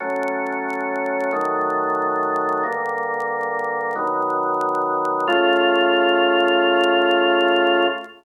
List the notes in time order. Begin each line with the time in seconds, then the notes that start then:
0.00 F#3 A3 C#4
1.32 D#3 F#3 A3
2.63 G2 D3 A#3
3.95 B2 D#3 F#3
5.27 C#3 A3 F4